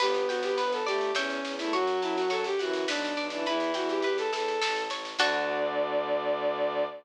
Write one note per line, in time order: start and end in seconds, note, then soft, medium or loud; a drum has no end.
0.00 0.25 G1 medium
0.00 0.79 B3 medium
0.00 0.26 G4 loud
0.00 0.57 B4 medium
0.00 kick medium
0.00 snare medium
0.00 crash medium
0.14 snare medium
0.29 0.53 G1 medium
0.29 0.42 F#4 medium
0.29 1.11 G5 medium
0.29 snare medium
0.43 0.57 G4 loud
0.43 snare medium
0.57 0.82 G1 medium
0.57 1.12 B4 medium
0.57 0.71 B4 loud
0.57 snare medium
0.72 0.86 A4 medium
0.72 snare medium
0.87 1.11 G1 medium
0.87 1.11 A3 medium
0.87 1.11 G4 loud
0.87 1.14 D5 medium
0.87 snare medium
1.01 snare medium
1.14 1.39 E2 medium
1.14 1.53 C#4 loud
1.14 1.68 C#5 medium
1.14 1.68 E5 medium
1.14 1.68 G5 medium
1.14 snare medium
1.30 snare medium
1.44 1.69 E2 medium
1.44 snare medium
1.59 1.74 A3 medium
1.59 1.72 E4 loud
1.59 snare medium
1.73 1.97 F#2 medium
1.73 2.44 F#3 loud
1.73 2.00 F#4 loud
1.73 2.30 C#5 medium
1.73 kick medium
1.73 snare medium
1.87 snare medium
2.02 2.27 F#2 medium
2.02 2.16 E4 medium
2.02 2.84 A5 medium
2.02 snare medium
2.16 2.30 F#4 medium
2.16 snare medium
2.30 2.55 F#2 medium
2.30 2.44 A4 loud
2.30 2.85 C#5 medium
2.30 snare medium
2.44 2.59 G4 loud
2.44 snare medium
2.59 2.85 F#2 medium
2.59 2.87 E3 medium
2.59 2.85 F#4 medium
2.59 2.87 F#5 medium
2.59 snare medium
2.73 snare medium
2.88 3.13 B1 medium
2.88 3.25 D4 loud
2.88 3.43 B4 medium
2.88 snare medium
3.04 snare medium
3.17 3.41 B1 medium
3.17 3.45 D5 medium
3.17 snare medium
3.30 3.46 E3 medium
3.30 3.45 D4 medium
3.30 snare medium
3.46 3.71 E2 medium
3.46 4.03 E3 loud
3.46 3.71 E4 loud
3.46 4.04 B4 medium
3.46 kick medium
3.46 snare medium
3.60 snare medium
3.74 4.00 E2 medium
3.74 3.89 F#4 medium
3.74 4.57 G5 medium
3.74 snare medium
3.89 4.03 G4 medium
3.89 snare medium
4.02 4.28 E2 medium
4.02 4.17 G4 loud
4.02 4.59 B4 medium
4.02 snare medium
4.18 4.32 A4 loud
4.18 snare medium
4.32 4.57 E2 medium
4.32 4.83 A4 loud
4.32 4.60 E5 medium
4.32 snare medium
4.48 snare medium
4.62 4.87 A1 medium
4.62 5.16 A4 medium
4.62 snare loud
4.76 snare medium
4.89 5.14 A1 medium
4.89 5.18 C#5 medium
4.89 snare medium
5.05 snare medium
5.18 6.84 D2 loud
5.18 6.84 D3 loud
5.18 6.85 D4 loud
5.18 6.85 F#4 loud
5.18 6.85 A4 medium
5.18 6.85 D5 loud
5.18 kick loud
5.18 crash loud